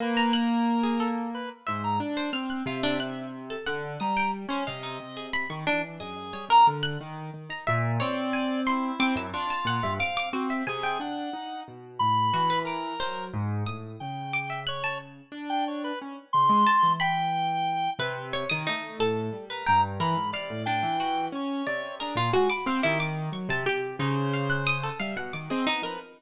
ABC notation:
X:1
M:6/8
L:1/16
Q:3/8=60
K:none
V:1 name="Lead 1 (square)"
B2 ^A5 z B z c ^a | z4 e4 z4 | ^a2 z2 ^d4 z4 | ^G3 ^a z8 |
d4 E4 F4 | f2 z2 ^G2 ^f4 z2 | b4 ^A4 z4 | g4 ^c2 z3 g c B |
z2 c'4 g6 | z9 ^A ^a z | b2 d2 g4 ^c4 | ^G z ^g b c =G z6 |
c6 e z2 ^d z B |]
V:2 name="Harpsichord"
z ^a ^f' z2 ^G =A2 z2 e2 | z c f' ^f' =F D ^f'2 z A ^f2 | ^d' g z c f ^D z ^G b ^c' =D z | ^d z ^c ^A z ^f' z3 ^a e2 |
^c2 ^g2 =c'2 d' e' ^c' a ^f e | d' d' ^F e ^g =g7 | z2 ^F B d'2 c2 z2 ^d'2 | z2 d' e ^f' a z6 |
z4 a2 b6 | B2 ^c ^d' ^D2 A3 B g2 | ^A2 f2 D2 ^F4 d2 | ^A F ^F d' =f E d'2 ^c' =a G2 |
^D z f ^f' ^d' A =f ^f =d' ^G ^D ^A |]
V:3 name="Acoustic Grand Piano"
^A,10 ^G,,2 | D2 C2 C,6 D,2 | G,3 ^C =C,2 C,3 ^D, E,2 | ^F,,2 G, C, D,2 ^D,2 D, ^D ^A,,2 |
C6 C ^F,, D z ^A,, G,, | C2 C2 C,2 D2 ^D2 B,,2 | A,,2 E,4 ^F,2 ^G,,2 A,,2 | ^C,8 D4 |
^C z ^C, ^G, z E,7 | C,3 ^D, A,2 A,,2 G,2 G,,2 | E, ^G,, C, A,, A,, E,3 ^C2 =C,2 | D ^A,, ^G, z C ^D,3 ^F, C, C,2 |
^C,6 G, B,, ^D, =C B, F, |]